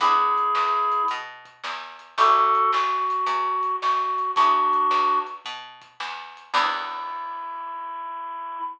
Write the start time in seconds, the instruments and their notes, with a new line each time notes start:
0.00 electric bass (finger) E2, acoustic guitar (steel) B3 D4 E4 G#4, clarinet E4 G#4, kick, closed hi-hat
0.37 kick, closed hi-hat
0.55 electric bass (finger) E2, snare
0.92 closed hi-hat
1.08 electric bass (finger) B2, kick, closed hi-hat
1.45 kick, closed hi-hat
1.64 electric bass (finger) E2, snare
1.99 closed hi-hat
2.17 electric bass (finger) A1, acoustic guitar (steel) C#4 E4 G4 A4, clarinet F#4 A4, kick, closed hi-hat
2.54 kick, closed hi-hat
2.73 electric bass (finger) A1, clarinet F#4, snare
3.10 closed hi-hat
3.26 electric bass (finger) E2, kick, closed hi-hat
3.63 kick, closed hi-hat
3.82 electric bass (finger) A1, clarinet F#4, snare
4.18 closed hi-hat
4.35 electric bass (finger) E2, acoustic guitar (steel) B3 D4 E4 G#4, clarinet D4 F#4, kick, closed hi-hat
4.73 kick, closed hi-hat
4.91 electric bass (finger) E2, snare
5.27 closed hi-hat
5.45 electric bass (finger) B2, kick, closed hi-hat
5.82 kick, closed hi-hat
6.00 electric bass (finger) E2, snare
6.37 closed hi-hat
6.54 electric bass (finger) E2, acoustic guitar (steel) B3 D4 E4 G#4, clarinet E4, kick, crash